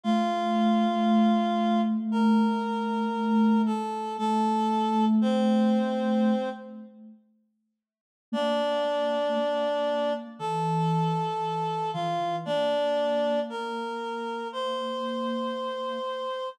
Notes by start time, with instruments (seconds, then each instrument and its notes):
0.03 ocarina A3, clarinet F4 F5
2.12 clarinet A#4 A#5
3.66 clarinet A4 A5
4.18 ocarina A3, clarinet A4 A5
5.21 clarinet C4 C5
8.32 ocarina A#3, clarinet D4 D5
9.35 ocarina A#3
10.39 ocarina E3, clarinet A4 A5
11.93 ocarina E3, clarinet F4 F5
12.20 ocarina E3
12.45 ocarina A#3, clarinet D4 D5
13.50 clarinet A#4 A#5
14.52 clarinet C5 C6